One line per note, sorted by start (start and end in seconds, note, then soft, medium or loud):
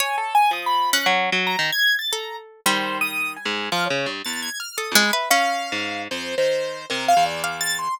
0.00 0.48 C#5 medium
0.00 0.16 G#5 medium
0.18 0.34 A4 medium
0.35 0.51 G#5 loud
0.51 0.99 F3 medium
0.51 0.65 D#6 medium
0.66 0.90 B5 medium
0.93 2.01 C#4 medium
0.93 1.06 F#6 loud
1.06 1.30 F#3 loud
1.32 1.56 F#3 loud
1.47 1.71 A#5 medium
1.59 1.71 D#3 loud
1.72 1.96 G#6 loud
1.99 2.11 A6 medium
2.12 2.60 A4 medium
2.12 2.36 A#5 medium
2.66 3.38 D#3 medium
2.66 4.57 G3 medium
2.66 2.98 C5 medium
3.01 3.33 D#6 loud
3.36 3.68 G#5 medium
3.45 3.69 G#2 medium
3.72 3.88 F3 loud
3.72 3.84 F6 medium
3.86 4.10 C#5 medium
3.90 4.06 C#3 medium
4.06 4.22 G2 medium
4.25 4.49 E2 medium
4.25 4.40 A6 medium
4.42 4.58 G#6 medium
4.60 4.76 F6 medium
4.77 4.94 A4 medium
4.77 4.93 D#6 medium
4.91 5.03 F2 medium
4.91 5.11 G#3 loud
4.96 5.12 B5 medium
5.13 5.29 B4 medium
5.13 5.29 E5 soft
5.30 7.22 C#4 medium
5.30 6.02 F5 loud
5.72 6.08 G#2 medium
6.11 6.35 F2 medium
6.11 6.35 C5 medium
6.38 6.86 D#3 soft
6.38 6.86 C5 medium
6.90 7.14 C3 medium
6.90 7.06 A#4 loud
7.08 7.24 F5 loud
7.17 7.88 E2 medium
7.26 7.42 D5 medium
7.44 7.92 F5 medium
7.44 7.60 D6 medium
7.61 7.77 A6 loud
7.79 7.95 C6 medium